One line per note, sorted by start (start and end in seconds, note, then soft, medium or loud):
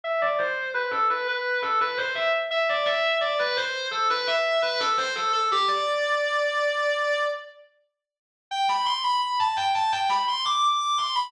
0.04 0.20 E5 loud
0.21 0.38 D5 loud
0.38 0.71 C5 loud
0.74 0.91 B4 loud
0.91 1.08 A4 loud
1.10 1.26 B4 medium
1.28 1.61 B4 loud
1.62 1.79 A4 medium
1.81 1.97 B4 loud
1.97 2.14 C5 loud
2.15 2.32 E5 loud
2.51 2.67 E5 loud
2.69 2.86 D5 loud
2.86 3.17 E5 loud
3.21 3.37 D5 loud
3.39 3.56 B4 loud
3.57 3.87 C5 loud
3.91 4.08 A4 medium
4.10 4.27 B4 loud
4.27 4.60 E5 medium
4.62 4.79 B4 loud
4.80 4.97 A4 loud
4.97 5.14 C5 loud
5.15 5.32 A4 medium
5.32 5.49 A4 loud
5.51 5.68 G4 loud
5.68 7.24 D5 loud
8.51 8.67 G5 loud
8.69 8.85 B5 loud
8.85 9.02 C6 loud
9.03 9.20 B5 loud
9.21 9.38 B5 medium
9.39 9.56 A5 medium
9.56 9.73 G5 loud
9.74 9.91 A5 loud
9.92 10.09 G5 loud
10.09 10.26 B5 medium
10.28 10.44 C6 loud
10.45 10.62 D6 loud
10.62 10.79 D6 medium
10.80 10.97 D6 medium
10.98 11.14 C6 loud
11.15 11.31 B5 loud